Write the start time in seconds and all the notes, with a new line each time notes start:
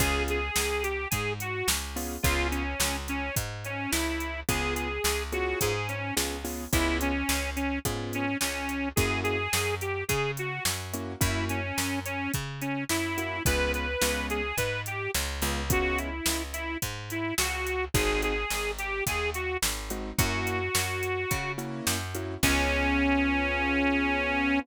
0.00 C#2 B3 C#4 F4 G#4, kick, closed hi-hat
0.28 G#4, closed hi-hat
0.56 C#2, snare
0.83 G4, closed hi-hat
1.11 G#2 G#4, kick, closed hi-hat
1.40 F#4, closed hi-hat
1.68 C#2, snare
1.96 B3 C#4 F4 G#4, open hi-hat
2.23 C#2 B3 C#4 F4 G#4, kick, closed hi-hat
2.51 C#4, closed hi-hat
2.80 C#2, snare
3.08 C#4, closed hi-hat
3.36 G#2, kick, closed hi-hat
3.64 C#4, closed hi-hat
3.91 C#2 E4, snare
4.20 closed hi-hat
4.49 C#2 B3 C#4 F4 G#4, kick, closed hi-hat
4.75 G#4, closed hi-hat
5.04 C#2, snare
5.32 B3 C#4 F4 F#4 G#4, closed hi-hat
5.61 G#2 G#4, kick, closed hi-hat
5.89 C#4, closed hi-hat
6.17 C#2 B3 C#4 F4 G#4, snare
6.45 B3 C#4 F4 G#4, open hi-hat
6.73 C#2 B3 C#4 E4 F4 G#4, kick, closed hi-hat
7.01 C#4, closed hi-hat
7.29 C#2, snare
7.56 C#4, closed hi-hat
7.85 G#2 B3 C#4 F4 G#4, kick, closed hi-hat
8.13 C#4, closed hi-hat
8.40 C#2 C#4, snare
8.69 closed hi-hat
8.96 F#2 A#3 C#4 E4 F#4 G#4, kick, closed hi-hat
9.24 G#4, closed hi-hat
9.53 F#2, snare
9.81 G4, closed hi-hat
10.08 C#3 G#4, kick, closed hi-hat
10.37 F#4, closed hi-hat
10.65 F#2, snare
10.93 A#3 C#4 E4 F#4, closed hi-hat
11.20 F#2 A#3 C#4 E4 F#4, kick, closed hi-hat
11.49 C#4, closed hi-hat
11.78 F#2, snare
12.05 C#4, closed hi-hat
12.34 C#3, kick, closed hi-hat
12.61 C#4, closed hi-hat
12.89 F#2 E4, snare
13.18 A#3 C#4 E4 F#4, closed hi-hat
13.45 C#2 G#3 B3 C#4 F4 B4, kick, closed hi-hat
13.74 B4, closed hi-hat
14.02 C#2 G#3 B3 C#4 F4, snare
14.30 G#4, closed hi-hat
14.57 G#2 B4, kick, closed hi-hat
14.86 G4, closed hi-hat
15.14 C#2, snare
15.42 C#2 G#3 B3 C#4 F4, closed hi-hat
15.70 G#3 B3 C#4 F4 F#4, kick, closed hi-hat
15.98 E4, closed hi-hat
16.26 C#2, snare
16.53 E4, closed hi-hat
16.82 G#2, kick, closed hi-hat
17.10 E4, closed hi-hat
17.38 C#2 F#4, snare
17.67 closed hi-hat
17.94 G#1 G#3 C4 D#4 F#4 G#4, kick, closed hi-hat
18.22 G#4, closed hi-hat
18.50 G#1, snare
18.79 G4, closed hi-hat
19.07 D#2 G#4, kick, closed hi-hat
19.34 F#4, closed hi-hat
19.62 G#1, snare
19.90 G#3 C4 D#4 F#4, closed hi-hat
20.18 F#2 A#3 C#4 E4 F#4, kick, closed hi-hat
20.47 closed hi-hat
20.75 F#2, snare
21.03 closed hi-hat
21.31 C#3, kick, closed hi-hat
21.58 A#3 C#4 E4 F#4, closed hi-hat
21.87 F#2, snare
22.15 A#3 C#4 E4 F#4, closed hi-hat
22.43 C#2 B3 C#4 F4 G#4, kick, crash